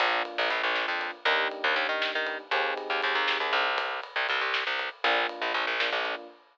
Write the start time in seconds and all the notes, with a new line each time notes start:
0.00 A#1 A#3 D4 F4, kick, ride
0.25 ride
0.38 A#1
0.50 A#1, ride
0.63 A#1
0.76 snare
0.88 F2
1.01 ride
1.25 D#2 A#3 D4 D#4 G4, kick, ride
1.51 ride
1.64 D#2
1.76 D#2, ride
1.89 D#3
2.02 snare
2.15 D#3
2.27 ride
2.51 D#2 C4 D#4 G4 G#4, kick, ride
2.77 ride
2.90 D#2
3.02 D#2, ride
3.15 D#2
3.28 snare
3.40 D#2
3.53 C2, ride
3.78 kick, ride
4.03 ride
4.16 C2
4.29 C2, ride
4.41 C2
4.54 snare
4.67 C2
4.79 ride
5.04 A#1 A#3 D4 F4, kick, ride
5.29 ride
5.42 A#1
5.54 A#1, ride
5.67 A#1
5.80 A#3 D4 F4, snare
5.92 A#1
6.05 ride